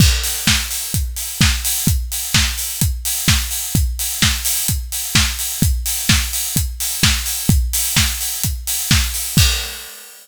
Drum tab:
CC |x-------|--------|--------|--------|
HH |-o-oxo-o|xo-oxo-o|xo-oxo-o|xo-oxo-o|
SD |--o---o-|--o---o-|--o---o-|--o---o-|
BD |o-o-o-o-|o-o-o-o-|o-o-o-o-|o-o-o-o-|

CC |--------|x-------|
HH |xo-oxo-o|--------|
SD |--o---o-|--------|
BD |o-o-o-o-|o-------|